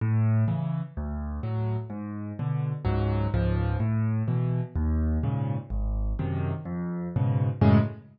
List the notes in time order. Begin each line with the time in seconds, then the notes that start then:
0.01 A2
0.48 C#3 E3
0.97 D2
1.43 A2 F#3
1.90 G#2
2.39 B2 D3
2.85 C#2 G#2 F#3
3.34 C#2 G#2 F3
3.80 A2
4.28 B2 E3
4.76 D#2
5.23 G#2 A#2 C#3
5.70 G#1
6.19 F#2 C3 D#3
6.65 F2
7.16 G#2 B2 C#3
7.61 F#2 A2 C#3 G#3